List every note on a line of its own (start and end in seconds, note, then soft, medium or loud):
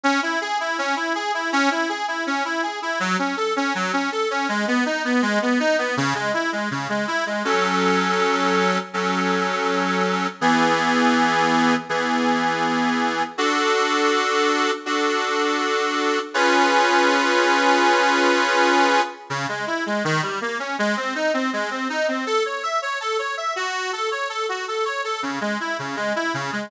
0.04 0.20 C#4 loud
0.23 0.39 E4 medium
0.41 0.58 G#4 loud
0.60 0.77 E4 medium
0.78 0.95 C#4 loud
0.96 1.13 E4 medium
1.15 1.32 G#4 loud
1.34 1.51 E4 medium
1.52 1.69 C#4 loud
1.71 1.88 E4 medium
1.89 2.06 G#4 medium
2.08 2.25 E4 medium
2.27 2.43 C#4 loud
2.45 2.62 E4 medium
2.63 2.80 G#4 medium
2.82 2.99 E4 medium
3.00 3.17 F#3 loud
3.19 3.35 C#4 medium
3.37 3.54 A4 medium
3.56 3.73 C#4 loud
3.75 3.92 F#3 loud
3.93 4.10 C#4 medium
4.12 4.29 A4 medium
4.31 4.47 C#4 loud
4.49 4.65 G#3 loud
4.68 4.84 B3 loud
4.86 5.03 D#4 medium
5.05 5.21 B3 medium
5.22 5.39 G#3 loud
5.42 5.59 B3 medium
5.60 5.76 D#4 loud
5.78 5.95 B3 medium
5.97 6.14 C#3 loud
6.15 6.32 G#3 medium
6.34 6.51 E4 medium
6.52 6.69 G#3 medium
6.71 6.88 C#3 medium
6.89 7.06 G#3 medium
7.08 7.24 E4 loud
7.26 7.43 G#3 medium
7.45 8.78 F#3 medium
7.45 8.78 C#4 medium
7.45 8.78 A4 medium
8.94 10.27 F#3 medium
8.94 10.27 C#4 medium
8.94 10.27 A4 medium
10.41 11.74 E3 medium
10.41 11.74 B3 medium
10.41 11.74 G#4 medium
11.89 13.23 E3 medium
11.89 13.23 B3 medium
11.89 13.23 G#4 medium
13.38 14.71 D4 medium
13.38 14.71 F#4 medium
13.38 14.71 A4 medium
14.86 16.19 D4 medium
14.86 16.19 F#4 medium
14.86 16.19 A4 medium
16.34 19.01 C#4 medium
16.34 19.01 F4 medium
16.34 19.01 G#4 medium
16.34 19.01 B4 loud
19.30 19.46 C#3 loud
19.49 19.65 G#3 medium
19.67 19.84 E4 medium
19.86 20.03 G#3 medium
20.05 20.21 D#3 loud
20.23 20.39 G3 medium
20.41 20.58 A#3 medium
20.59 20.76 C#4 medium
20.79 20.95 G#3 loud
20.97 21.14 C4 medium
21.15 21.32 D#4 medium
21.34 21.50 C4 medium
21.53 21.70 G#3 medium
21.71 21.87 C4 medium
21.90 22.06 D#4 medium
22.08 22.25 C4 medium
22.26 22.43 A4 loud
22.45 22.62 C#5 medium
22.63 22.80 E5 medium
22.82 22.99 C#5 medium
23.01 23.17 A4 medium
23.19 23.35 C#5 medium
23.37 23.54 E5 medium
23.56 23.91 F#4 loud
23.93 24.09 A4 medium
24.11 24.28 C#5 medium
24.30 24.46 A4 medium
24.49 24.66 F#4 medium
24.68 24.85 A4 medium
24.85 25.02 C#5 medium
25.04 25.21 A4 medium
25.23 25.39 C#3 medium
25.41 25.58 G#3 medium
25.60 25.77 E4 medium
25.79 25.96 C#3 medium
25.96 26.13 G#3 medium
26.16 26.32 E4 medium
26.34 26.51 C#3 medium
26.52 26.69 G#3 medium